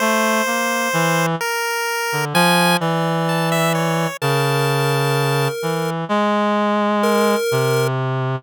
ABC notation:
X:1
M:9/8
L:1/16
Q:3/8=43
K:none
V:1 name="Clarinet"
A,2 ^A,2 E,2 z3 D, F,2 E,6 | ^C,6 E,2 ^G,6 =C,4 |]
V:2 name="Lead 1 (square)"
z12 d6 | ^A8 z4 A4 z2 |]
V:3 name="Lead 1 (square)"
c6 ^A4 ^g2 z2 =a e ^c2 | a6 z12 |]